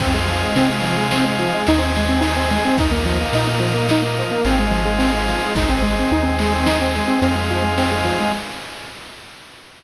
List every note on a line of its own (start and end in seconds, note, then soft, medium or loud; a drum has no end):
0.00 0.44 F2 loud
0.00 0.12 C4 medium
0.00 1.63 C4 medium
0.00 1.63 D#4 medium
0.00 1.63 F4 medium
0.00 1.63 G#4 medium
0.00 kick medium
0.00 crash medium
0.14 0.27 G#3 medium
0.28 0.41 F3 medium
0.28 ride medium
0.43 0.55 G#3 medium
0.56 1.44 C3 medium
0.56 0.69 C4 medium
0.56 ride medium
0.67 0.80 G#3 medium
0.82 0.95 F3 medium
0.82 ride medium
0.97 1.10 G#3 medium
1.11 1.25 C4 medium
1.11 snare loud
1.24 1.37 G#3 medium
1.39 1.52 F3 medium
1.39 ride medium
1.54 1.67 G#3 medium
1.67 2.57 D#2 loud
1.67 2.76 C4 medium
1.67 2.76 D#4 medium
1.67 1.81 D#4 medium
1.67 2.76 G#4 medium
1.67 ride loud
1.78 1.91 C4 medium
1.95 2.09 G#3 medium
1.95 ride medium
2.09 2.21 C4 medium
2.21 2.34 D#4 medium
2.21 ride medium
2.36 2.49 C4 medium
2.50 2.64 G#3 medium
2.50 ride medium
2.65 2.78 C4 medium
2.77 3.22 D#2 loud
2.77 4.41 A#3 medium
2.77 4.41 D#4 medium
2.77 2.92 D#4 medium
2.77 4.41 F4 medium
2.77 kick medium
2.77 ride medium
2.91 3.04 A#3 medium
3.05 3.18 F3 medium
3.05 ride medium
3.21 3.34 A#3 medium
3.33 4.21 A#2 medium
3.33 3.47 D#4 medium
3.33 ride medium
3.47 3.60 A#3 medium
3.60 3.72 F3 medium
3.60 ride medium
3.74 3.87 A#3 medium
3.89 4.03 D#4 medium
3.89 snare loud
4.02 4.15 A#3 medium
4.17 4.31 F3 medium
4.17 ride medium
4.31 4.44 A#3 medium
4.45 5.34 G#1 loud
4.45 5.54 G#3 medium
4.45 5.54 C4 medium
4.45 4.59 C4 medium
4.45 5.54 D#4 medium
4.45 5.54 F4 medium
4.45 ride medium
4.59 4.72 G#3 medium
4.71 4.84 F3 medium
4.71 ride medium
4.85 4.98 G#3 medium
4.99 5.11 C4 medium
4.99 ride medium
5.12 5.25 G#3 medium
5.28 5.41 F3 medium
5.28 ride medium
5.43 5.56 G#3 medium
5.55 6.00 G#1 loud
5.55 7.19 G#3 medium
5.55 7.19 C4 medium
5.55 5.69 D#4 medium
5.55 7.19 D#4 medium
5.55 kick medium
5.55 ride medium
5.69 5.82 C4 medium
5.82 5.95 G#3 medium
5.82 ride medium
5.99 6.12 C4 medium
6.11 7.00 D#2 medium
6.11 6.25 D#4 medium
6.23 6.36 C4 medium
6.39 6.53 G#3 medium
6.39 ride medium
6.54 6.67 C4 medium
6.66 6.79 D#4 medium
6.66 snare loud
6.81 6.94 C4 medium
6.95 7.08 G#3 medium
6.95 ride medium
7.08 7.20 C4 medium
7.22 8.11 F2 loud
7.22 8.31 G#3 medium
7.22 7.35 C4 medium
7.22 8.31 C4 medium
7.22 8.31 D#4 medium
7.22 8.31 F4 medium
7.22 ride medium
7.35 7.48 G#3 medium
7.50 7.63 F3 medium
7.50 ride medium
7.62 7.75 G#3 medium
7.78 7.90 C4 medium
7.78 ride medium
7.92 8.04 G#3 medium
8.05 8.17 F3 medium
8.05 ride medium
8.20 8.32 G#3 medium